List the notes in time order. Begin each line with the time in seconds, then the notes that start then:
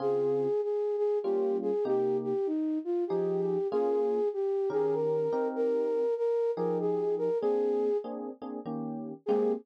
0.00 C#3 C4 F4 G#4
0.63 G#4
0.97 G#4
1.23 G3 A#3 C#4 F4 G4
1.62 G#4
1.85 C3 A#3 D#4 G4
2.23 G4
2.46 D#4
2.85 F4
3.07 F3 D#4 G4 G#4
3.71 A#3 C#4 F4 G#4
4.33 G4
4.70 D#3 C#4 G4 G#4 A#4
4.94 A#4
5.32 C4 D#4 G4 A#4
5.55 A#4
6.17 A#4
6.56 F3 D#4 G4 G#4 A#4
6.80 G#4
7.18 A#4
7.41 A#3 C4 D4 G#4
8.04 A#3 C4 D4 G#4
8.42 A#3 C4 D4 G#4
8.66 D#3 A#3 C#4 G4
9.26 G#3 A#3 C4 G4 G#4